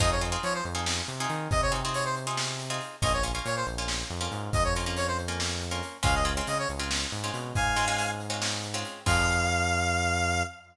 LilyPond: <<
  \new Staff \with { instrumentName = "Lead 1 (square)" } { \time 7/8 \key f \minor \tempo 4 = 139 ees''16 des''16 r8 des''16 c''16 r2 | ees''16 des''16 r8 des''16 c''16 r2 | ees''16 des''16 r8 des''16 c''16 r2 | ees''16 des''16 r8 des''16 c''16 r2 |
f''16 ees''16 r8 ees''16 des''16 r2 | <f'' aes''>4. r2 | f''2.~ f''8 | }
  \new Staff \with { instrumentName = "Pizzicato Strings" } { \time 7/8 \key f \minor <c' ees' f' aes'>8 <c' ees' f' aes'>16 <c' ees' f' aes'>4 <c' ees' f' aes'>4 <c' ees' f' aes'>8.~ | <c' ees' f' aes'>8 <c' ees' f' aes'>16 <c' ees' f' aes'>4 <c' ees' f' aes'>4 <c' ees' f' aes'>8. | <bes des' f'>8 <bes des' f'>16 <bes des' f'>4 <bes des' f'>4 <bes des' f'>8.~ | <bes des' f'>8 <bes des' f'>16 <bes des' f'>4 <bes des' f'>4 <bes des' f'>8. |
<aes c' des' f'>8 <aes c' des' f'>16 <aes c' des' f'>4 <aes c' des' f'>4 <aes c' des' f'>8.~ | <aes c' des' f'>8 <aes c' des' f'>16 <aes c' des' f'>4 <aes c' des' f'>4 <aes c' des' f'>8. | <c' ees' f' aes'>2.~ <c' ees' f' aes'>8 | }
  \new Staff \with { instrumentName = "Synth Bass 1" } { \clef bass \time 7/8 \key f \minor f,4 f8 f,4 c8 ees8 | c2.~ c8 | bes,,4 bes,8 bes,,4 f,8 aes,8 | f,2.~ f,8 |
des,4 des8 des,4 aes,8 b,8 | aes,2.~ aes,8 | f,2.~ f,8 | }
  \new DrumStaff \with { instrumentName = "Drums" } \drummode { \time 7/8 <hh bd>8 hh8 hh8 hh8 sn8 hh8 hh8 | <hh bd>8 hh8 hh8 hh8 sn8 hh8 hh8 | <hh bd>8 hh8 hh8 hh8 sn8 hh8 hh8 | <hh bd>8 hh8 hh8 hh8 sn8 hh8 hh8 |
<hh bd>8 hh8 hh8 hh8 sn8 hh8 hh8 | <hh bd>8 hh8 hh8 hh8 sn8 hh8 hh8 | <cymc bd>4 r4 r4. | }
>>